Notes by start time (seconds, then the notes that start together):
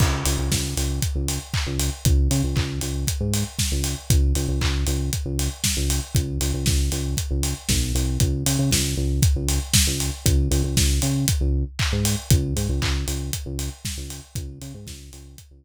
0.00 C#2, kick, crash
0.25 C#2, open hi-hat
0.38 C#2
0.51 C#2, kick, snare
0.77 C#2, open hi-hat
1.02 kick, closed hi-hat
1.15 C#2
1.28 open hi-hat
1.54 kick, clap
1.67 C#2
1.79 open hi-hat
2.05 C#2, kick, closed hi-hat
2.31 C#3, open hi-hat
2.44 C#2
2.56 C#2, kick, clap
2.81 C#2, open hi-hat
3.07 kick, closed hi-hat
3.21 G#2
3.34 open hi-hat
3.59 kick, snare
3.72 C#2
3.84 open hi-hat
4.10 C#2, kick, closed hi-hat
4.35 C#2, open hi-hat
4.49 C#2
4.61 C#2, kick, clap
4.87 C#2, open hi-hat
5.13 kick, closed hi-hat
5.26 C#2
5.39 open hi-hat
5.64 kick, snare
5.77 C#2
5.90 open hi-hat
6.15 C#2, kick, closed hi-hat
6.41 C#2, open hi-hat
6.54 C#2
6.66 C#2, kick, snare
6.92 C#2, open hi-hat
7.17 kick, closed hi-hat
7.31 C#2
7.43 open hi-hat
7.69 B1, kick, snare
7.95 C2, open hi-hat
8.20 C#2, kick, closed hi-hat
8.46 C#3, open hi-hat
8.59 C#3
8.71 C#2, kick, snare
8.97 C#2
9.22 kick, closed hi-hat
9.36 C#2
9.49 open hi-hat
9.74 kick, snare
9.87 C#2
10.00 open hi-hat
10.26 C#2, kick, closed hi-hat
10.51 C#2, open hi-hat
10.64 C#2
10.77 C#2, kick, snare
11.02 C#3, open hi-hat
11.28 kick, closed hi-hat
11.41 C#2
11.79 kick, clap
11.92 G#2
12.05 open hi-hat
12.30 C#2, kick, closed hi-hat
12.56 G#2, open hi-hat
12.69 C#2
12.82 C#2, kick, clap
13.08 C#2, open hi-hat
13.33 kick, closed hi-hat
13.46 C#2
13.59 open hi-hat
13.85 kick, snare
13.97 C#2
14.10 open hi-hat
14.35 C#2, kick, closed hi-hat
14.61 C#3, open hi-hat
14.74 G#2
14.87 C#2, kick, snare
15.13 C#2, open hi-hat
15.38 kick, closed hi-hat
15.51 C#2